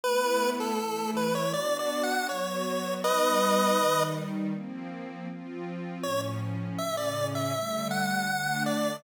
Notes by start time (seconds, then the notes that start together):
0.03 A3 B3 E4 B4
0.60 A4
0.79 E3 A3 E4
1.16 B4
1.35 C#5
1.53 B3 D4 F#4 D5
1.79 D5
2.03 F#5
2.28 F#3 B3 F#4 C#5
3.04 G3 B3 D#4 B4 D#5
3.79 D#3 G3 D#4
4.53 F3 A#3 C4
5.29 F3 C4 F4
6.03 A2 F3 C#4 C#5
6.78 A2 C#3 C#4 E5
6.97 D5
7.35 E5
7.54 D3 G3 A3
7.91 F#5
8.29 D3 A3 D4
8.66 D5